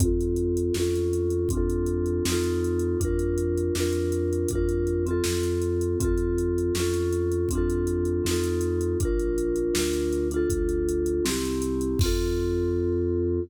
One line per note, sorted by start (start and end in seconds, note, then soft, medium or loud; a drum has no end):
0.00 0.70 F2 loud
0.00 0.74 C4 medium
0.00 0.74 F4 medium
0.00 kick medium
0.00 closed hi-hat medium
0.05 0.74 A4 medium
0.21 closed hi-hat medium
0.36 closed hi-hat medium
0.57 closed hi-hat medium
0.74 1.45 F2 medium
0.74 1.49 C#4 medium
0.74 1.49 F4 medium
0.74 snare medium
0.80 1.49 A4 medium
0.96 closed hi-hat medium
1.13 closed hi-hat medium
1.30 closed hi-hat medium
1.49 2.20 F2 medium
1.49 2.24 C4 medium
1.49 2.24 D4 medium
1.49 kick medium
1.49 closed hi-hat medium
1.55 2.24 F4 medium
1.55 2.24 A4 medium
1.70 closed hi-hat medium
1.86 closed hi-hat medium
2.06 closed hi-hat soft
2.25 2.95 F2 medium
2.25 2.99 C4 medium
2.25 2.99 D#4 medium
2.25 snare loud
2.30 2.99 F4 medium
2.30 2.99 A4 medium
2.43 closed hi-hat medium
2.64 closed hi-hat medium
2.79 closed hi-hat medium
3.00 3.70 F2 medium
3.00 3.74 D4 medium
3.00 3.74 F4 medium
3.00 kick medium
3.00 closed hi-hat medium
3.05 3.74 A#4 medium
3.19 closed hi-hat medium
3.38 closed hi-hat medium
3.58 closed hi-hat medium
3.75 4.45 F2 medium
3.75 4.49 D4 medium
3.75 4.49 F4 medium
3.75 snare medium
3.80 4.49 A#4 medium
3.93 closed hi-hat medium
4.12 closed hi-hat medium
4.33 closed hi-hat medium
4.48 5.20 F2 medium
4.48 5.05 D4 medium
4.48 kick medium
4.48 closed hi-hat medium
4.53 5.05 F4 medium
4.53 5.05 A#4 medium
4.69 closed hi-hat medium
4.87 closed hi-hat medium
5.06 5.99 C4 medium
5.06 5.99 F4 medium
5.06 closed hi-hat medium
5.11 5.99 A4 medium
5.24 5.95 F2 medium
5.24 snare loud
5.43 closed hi-hat medium
5.62 closed hi-hat medium
5.81 closed hi-hat medium
6.00 6.70 F2 loud
6.00 6.74 C4 medium
6.00 6.74 F4 medium
6.00 kick loud
6.00 closed hi-hat medium
6.05 6.74 A4 medium
6.18 closed hi-hat medium
6.38 closed hi-hat medium
6.58 closed hi-hat medium
6.75 7.45 F2 loud
6.75 7.49 C#4 medium
6.75 7.49 F4 medium
6.75 snare medium
6.80 7.49 A4 medium
6.94 closed hi-hat medium
7.12 closed hi-hat medium
7.32 closed hi-hat medium
7.49 8.20 F2 medium
7.49 8.24 C4 medium
7.49 kick medium
7.49 closed hi-hat medium
7.53 8.24 D4 medium
7.53 8.24 F4 medium
7.58 8.24 A4 medium
7.70 closed hi-hat medium
7.87 closed hi-hat medium
8.05 closed hi-hat medium
8.24 8.95 F2 loud
8.24 8.98 C4 medium
8.24 8.98 D#4 medium
8.24 snare medium
8.29 8.98 F4 medium
8.29 8.98 A4 medium
8.44 closed hi-hat medium
8.61 closed hi-hat medium
8.81 closed hi-hat medium
9.00 9.70 A#1 loud
9.00 9.74 D4 medium
9.00 9.74 F4 medium
9.00 kick loud
9.00 closed hi-hat medium
9.05 9.74 A#4 medium
9.19 closed hi-hat medium
9.38 closed hi-hat medium
9.56 closed hi-hat medium
9.74 10.45 D2 medium
9.74 10.28 D4 medium
9.74 10.28 F4 medium
9.74 snare loud
9.79 10.28 A#4 medium
9.93 closed hi-hat medium
10.13 closed hi-hat medium
10.31 11.24 D4 medium
10.31 11.24 F4 medium
10.31 closed hi-hat medium
10.36 11.24 A4 medium
10.50 11.20 D2 medium
10.50 kick medium
10.50 closed hi-hat medium
10.69 closed hi-hat medium
10.89 closed hi-hat medium
11.06 closed hi-hat medium
11.25 11.95 C2 loud
11.25 11.98 C4 medium
11.25 11.98 E4 medium
11.25 snare loud
11.29 11.98 G4 medium
11.45 closed hi-hat medium
11.62 closed hi-hat medium
11.81 closed hi-hat medium
11.99 13.39 F2 loud
11.99 13.40 C4 medium
11.99 kick loud
11.99 crash loud
12.03 13.40 F4 loud
12.03 13.40 A4 loud